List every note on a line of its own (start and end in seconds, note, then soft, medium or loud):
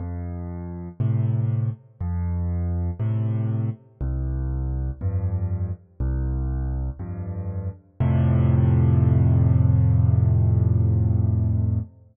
0.00 0.89 F2 medium
1.00 1.70 A2 medium
1.00 1.70 C3 medium
2.01 2.91 F2 loud
3.00 3.70 A2 medium
3.00 3.70 C3 medium
4.01 4.91 C2 loud
5.01 5.71 F2 medium
5.01 5.71 G2 medium
6.00 6.90 C2 loud
6.99 7.69 F2 medium
6.99 7.69 G2 medium
8.00 11.80 F2 loud
8.00 11.80 A2 loud
8.00 11.80 C3 loud